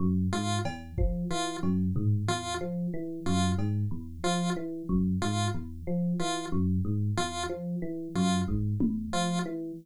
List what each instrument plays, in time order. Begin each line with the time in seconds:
0.00 electric piano 1 F#2
0.33 electric piano 1 G#2, lead 1 (square) F4
0.65 electric piano 1 E2, cowbell
0.98 electric piano 1 F3, kick
1.30 electric piano 1 E3, lead 1 (square) F4
1.63 electric piano 1 F#2, cowbell
1.96 electric piano 1 G#2, floor tom
2.28 electric piano 1 E2, lead 1 (square) F4
2.61 electric piano 1 F3
2.94 electric piano 1 E3
3.26 electric piano 1 F#2, lead 1 (square) F4
3.58 electric piano 1 G#2, cowbell
3.91 electric piano 1 E2
4.24 electric piano 1 F3, lead 1 (square) F4
4.56 electric piano 1 E3
4.89 electric piano 1 F#2, kick
5.22 electric piano 1 G#2, lead 1 (square) F4
5.54 electric piano 1 E2
5.87 electric piano 1 F3
6.19 electric piano 1 E3, lead 1 (square) F4
6.52 electric piano 1 F#2
6.85 electric piano 1 G#2
7.17 electric piano 1 E2, lead 1 (square) F4
7.49 electric piano 1 F3
7.82 electric piano 1 E3
8.15 electric piano 1 F#2, lead 1 (square) F4
8.48 electric piano 1 G#2, kick
8.80 electric piano 1 E2, high tom
9.13 electric piano 1 F3, lead 1 (square) F4
9.46 electric piano 1 E3